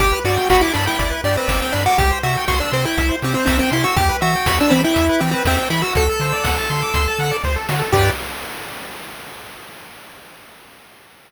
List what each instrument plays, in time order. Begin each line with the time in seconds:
0.00 synth bass 1 G1, lead 1 (square) G4, kick, closed hi-hat
0.12 lead 1 (square) B4
0.24 synth bass 1 G2, lead 1 (square) F#4 D5, open hi-hat
0.37 lead 1 (square) G5
0.50 synth bass 1 G1, lead 1 (square) F#4 B5, kick, snare
0.61 lead 1 (square) E4 D6
0.73 synth bass 1 G2, lead 1 (square) D4 B5, open hi-hat
0.86 lead 1 (square) E4 G5
0.98 synth bass 1 G1, lead 1 (square) D5, kick, closed hi-hat
1.10 lead 1 (square) B4
1.24 synth bass 1 G2, lead 1 (square) D4 G4, open hi-hat
1.37 lead 1 (square) C4 B4
1.47 synth bass 1 G1, lead 1 (square) C4 D5, kick, snare
1.61 lead 1 (square) C4 G5
1.72 synth bass 1 G2, lead 1 (square) D4 B5, open hi-hat
1.86 lead 1 (square) F#4 D6
1.98 synth bass 1 C2, lead 1 (square) G4, kick, closed hi-hat
2.11 lead 1 (square) C5
2.23 synth bass 1 C3, lead 1 (square) F#4 E5, open hi-hat
2.37 lead 1 (square) G5
2.48 synth bass 1 C2, lead 1 (square) F#4 C6, kick, snare
2.60 lead 1 (square) D4 E6
2.71 synth bass 1 C3, lead 1 (square) C4 C6, open hi-hat
2.85 lead 1 (square) E4 G5
2.98 synth bass 1 C2, lead 1 (square) E5, kick, closed hi-hat
3.09 lead 1 (square) C5
3.22 synth bass 1 C3, lead 1 (square) C4 G4, open hi-hat
3.34 lead 1 (square) C4 C5
3.46 synth bass 1 C2, lead 1 (square) C4 E5, kick, snare
3.59 lead 1 (square) C4 G5
3.70 synth bass 1 C3, lead 1 (square) E4 C6, open hi-hat
3.84 lead 1 (square) F#4 E6
3.96 synth bass 1 E2, lead 1 (square) G4, kick, closed hi-hat
4.09 lead 1 (square) B4
4.21 synth bass 1 E3, lead 1 (square) F#4 E5, open hi-hat
4.36 lead 1 (square) G5
4.46 synth bass 1 E2, lead 1 (square) F#4 B5, kick, snare
4.60 lead 1 (square) D4 E6
4.70 synth bass 1 E3, lead 1 (square) C4 B5, open hi-hat
4.84 lead 1 (square) E4 G5
4.94 synth bass 1 E2, lead 1 (square) E5, kick, closed hi-hat
5.09 lead 1 (square) B4
5.19 synth bass 1 E3, lead 1 (square) C4 G4, open hi-hat
5.31 lead 1 (square) C4 B4
5.45 synth bass 1 E2, lead 1 (square) C4 E5, kick, snare
5.57 lead 1 (square) C4 G5
5.70 synth bass 1 E3, lead 1 (square) E4 B5, open hi-hat
5.82 lead 1 (square) F#4 E6
5.93 synth bass 1 D2, lead 1 (square) F#4 A4, kick, closed hi-hat
6.09 lead 1 (square) A4
6.20 synth bass 1 D3, lead 1 (square) C5, open hi-hat
6.32 lead 1 (square) D5
6.43 synth bass 1 D2, lead 1 (square) F#5, kick, snare
6.58 lead 1 (square) A5
6.69 synth bass 1 D3, lead 1 (square) C6, open hi-hat
6.82 lead 1 (square) D6
6.94 synth bass 1 D2, lead 1 (square) C6, kick, closed hi-hat
7.08 lead 1 (square) A5
7.19 synth bass 1 D3, lead 1 (square) F#5, open hi-hat
7.31 lead 1 (square) D5
7.44 synth bass 1 D2, lead 1 (square) C5, kick, snare
7.56 lead 1 (square) A4
7.69 synth bass 1 D3, lead 1 (square) F#4, snare
7.79 lead 1 (square) A4
7.92 synth bass 1 G2, lead 1 (square) G4 B4 D5, kick, crash